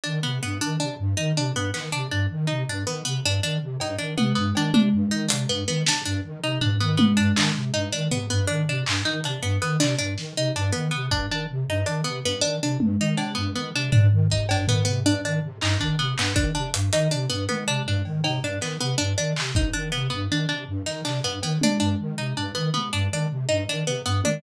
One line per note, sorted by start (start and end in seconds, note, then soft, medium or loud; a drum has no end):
0.04 0.20 D#3 medium
0.04 0.19 D4 medium
0.23 0.39 C3 medium
0.23 0.38 B3 medium
0.42 0.58 G2 medium
0.42 0.57 B3 medium
0.61 0.77 D#3 medium
0.61 0.76 D4 medium
0.80 0.96 C3 medium
0.80 0.95 D4 medium
0.99 1.14 G2 medium
1.17 1.32 D#3 medium
1.17 1.32 D#4 medium
1.36 1.51 C3 medium
1.36 1.52 D4 medium
1.55 1.70 G2 medium
1.55 1.71 B3 medium
1.74 1.89 D#3 medium
1.74 1.89 B3 medium
1.74 clap medium
1.92 2.08 C3 medium
1.92 2.07 D4 medium
2.11 2.26 G2 medium
2.11 2.26 D4 medium
2.30 2.45 D#3 medium
2.47 2.64 C3 medium
2.47 2.62 D#4 medium
2.68 2.83 G2 medium
2.68 2.84 D4 medium
2.86 3.01 D#3 medium
2.86 3.02 B3 medium
3.05 3.20 C3 medium
3.05 3.20 B3 medium
3.24 3.39 G2 medium
3.24 3.40 D4 medium
3.42 3.57 D#3 medium
3.42 3.58 D4 medium
3.61 3.76 C3 medium
3.80 3.95 G2 medium
3.80 3.96 D#4 medium
3.80 cowbell medium
3.98 4.14 D#3 medium
3.98 4.13 D4 medium
4.17 4.33 C3 medium
4.17 4.32 B3 medium
4.17 high tom medium
4.35 4.51 G2 medium
4.35 4.50 B3 medium
4.55 4.70 D#3 medium
4.55 4.72 D4 medium
4.55 cowbell medium
4.74 4.89 C3 medium
4.74 4.89 D4 medium
4.74 high tom loud
4.93 5.08 G2 medium
5.11 5.26 D#3 medium
5.11 5.26 D#4 medium
5.28 5.45 C3 medium
5.28 5.43 D4 medium
5.28 closed hi-hat loud
5.49 5.64 G2 medium
5.49 5.64 B3 medium
5.68 5.83 D#3 medium
5.68 5.83 B3 medium
5.86 6.01 C3 medium
5.86 6.03 D4 medium
5.86 snare loud
6.05 6.21 G2 medium
6.05 6.20 D4 medium
6.24 6.39 D#3 medium
6.43 6.58 C3 medium
6.43 6.58 D#4 medium
6.61 6.76 G2 medium
6.61 6.76 D4 medium
6.61 floor tom medium
6.80 6.95 D#3 medium
6.80 6.95 B3 medium
6.97 7.14 C3 medium
6.97 7.12 B3 medium
6.97 high tom loud
7.17 7.32 G2 medium
7.17 7.32 D4 medium
7.36 7.51 D#3 medium
7.36 7.52 D4 medium
7.36 clap loud
7.55 7.70 C3 medium
7.74 7.89 G2 medium
7.74 7.89 D#4 medium
7.92 8.08 D#3 medium
7.92 8.07 D4 medium
8.11 8.27 C3 medium
8.11 8.26 B3 medium
8.11 floor tom medium
8.30 8.45 G2 medium
8.30 8.45 B3 medium
8.47 8.64 D#3 medium
8.47 8.62 D4 medium
8.68 8.83 C3 medium
8.68 8.84 D4 medium
8.86 9.01 G2 medium
8.86 clap loud
9.05 9.20 D#3 medium
9.05 9.20 D#4 medium
9.24 9.39 C3 medium
9.24 9.40 D4 medium
9.24 closed hi-hat medium
9.42 9.57 G2 medium
9.42 9.57 B3 medium
9.61 9.76 D#3 medium
9.61 9.77 B3 medium
9.80 9.95 C3 medium
9.80 9.95 D4 medium
9.80 clap medium
9.98 10.14 G2 medium
9.98 10.13 D4 medium
10.18 10.33 D#3 medium
10.18 snare medium
10.36 10.51 C3 medium
10.36 10.52 D#4 medium
10.55 10.70 G2 medium
10.55 10.71 D4 medium
10.72 10.89 D#3 medium
10.72 10.87 B3 medium
10.91 11.08 C3 medium
10.91 11.06 B3 medium
11.11 11.26 G2 medium
11.11 11.26 D4 medium
11.11 kick medium
11.30 11.45 D#3 medium
11.30 11.46 D4 medium
11.49 11.64 C3 medium
11.68 11.83 G2 medium
11.68 11.84 D#4 medium
11.86 12.01 D#3 medium
11.86 12.01 D4 medium
11.86 closed hi-hat medium
12.04 12.20 C3 medium
12.04 12.19 B3 medium
12.24 12.39 G2 medium
12.24 12.40 B3 medium
12.41 12.58 D#3 medium
12.41 12.56 D4 medium
12.61 12.76 C3 medium
12.61 12.78 D4 medium
12.80 12.95 G2 medium
12.80 high tom medium
12.99 13.14 D#3 medium
12.99 13.16 D#4 medium
13.17 13.33 C3 medium
13.17 13.32 D4 medium
13.17 cowbell medium
13.35 13.51 G2 medium
13.35 13.50 B3 medium
13.55 13.70 D#3 medium
13.55 13.70 B3 medium
13.74 13.89 C3 medium
13.74 13.90 D4 medium
13.92 14.08 G2 medium
13.92 14.07 D4 medium
13.92 floor tom loud
14.11 14.26 D#3 medium
14.30 14.45 C3 medium
14.30 14.46 D#4 medium
14.30 kick medium
14.49 14.64 G2 medium
14.49 14.66 D4 medium
14.49 cowbell loud
14.68 14.83 D#3 medium
14.68 14.83 B3 medium
14.68 floor tom medium
14.85 15.02 C3 medium
14.85 15.00 B3 medium
15.05 15.20 G2 medium
15.05 15.21 D4 medium
15.24 15.39 D#3 medium
15.24 15.40 D4 medium
15.43 15.58 C3 medium
15.61 15.76 G2 medium
15.61 15.77 D#4 medium
15.61 clap loud
15.80 15.95 D#3 medium
15.80 15.95 D4 medium
15.80 kick medium
15.99 16.14 C3 medium
15.99 16.14 B3 medium
16.18 16.33 G2 medium
16.18 16.34 B3 medium
16.18 clap loud
16.35 16.51 D#3 medium
16.35 16.50 D4 medium
16.35 kick medium
16.55 16.70 C3 medium
16.55 16.70 D4 medium
16.74 16.89 G2 medium
16.74 closed hi-hat loud
16.93 17.07 D#3 medium
16.93 17.08 D#4 medium
16.93 closed hi-hat medium
17.11 17.27 C3 medium
17.11 17.26 D4 medium
17.29 17.45 G2 medium
17.29 17.44 B3 medium
17.49 17.64 D#3 medium
17.49 17.64 B3 medium
17.49 high tom medium
17.67 17.82 C3 medium
17.67 17.82 D4 medium
17.86 18.01 G2 medium
17.86 18.03 D4 medium
17.86 floor tom medium
18.05 18.20 D#3 medium
18.05 cowbell soft
18.24 18.39 C3 medium
18.24 18.39 D#4 medium
18.24 cowbell loud
18.42 18.57 G2 medium
18.42 18.59 D4 medium
18.61 18.76 D#3 medium
18.61 18.77 B3 medium
18.61 clap medium
18.80 18.95 C3 medium
18.80 18.95 B3 medium
18.98 19.14 G2 medium
18.98 19.13 D4 medium
19.18 19.33 D#3 medium
19.18 19.33 D4 medium
19.36 19.51 C3 medium
19.36 clap loud
19.55 19.70 G2 medium
19.55 19.71 D#4 medium
19.55 kick medium
19.73 19.89 D#3 medium
19.73 19.88 D4 medium
19.92 20.08 C3 medium
19.92 20.07 B3 medium
20.10 20.27 G2 medium
20.10 20.25 B3 medium
20.30 20.45 D#3 medium
20.30 20.47 D4 medium
20.49 20.64 C3 medium
20.49 20.64 D4 medium
20.68 20.83 G2 medium
20.86 21.01 D#3 medium
20.86 21.01 D#4 medium
20.86 snare soft
21.05 21.20 C3 medium
21.05 21.20 D4 medium
21.05 clap medium
21.24 21.39 G2 medium
21.24 21.39 B3 medium
21.43 21.58 D#3 medium
21.43 21.58 B3 medium
21.43 cowbell medium
21.61 21.77 C3 medium
21.61 21.78 D4 medium
21.61 high tom medium
21.80 21.95 G2 medium
21.80 21.95 D4 medium
21.99 22.14 D#3 medium
22.18 22.33 C3 medium
22.18 22.33 D#4 medium
22.37 22.52 G2 medium
22.37 22.52 D4 medium
22.55 22.70 D#3 medium
22.55 22.70 B3 medium
22.74 22.89 C3 medium
22.74 22.89 B3 medium
22.74 high tom soft
22.93 23.08 G2 medium
22.93 23.08 D4 medium
23.11 23.26 D#3 medium
23.11 23.28 D4 medium
23.30 23.45 C3 medium
23.49 23.64 G2 medium
23.49 23.64 D#4 medium
23.68 23.83 D#3 medium
23.68 23.84 D4 medium
23.86 24.01 C3 medium
23.86 24.02 B3 medium
24.05 24.20 G2 medium
24.05 24.20 B3 medium
24.24 24.39 D#3 medium
24.24 24.40 D4 medium
24.24 high tom medium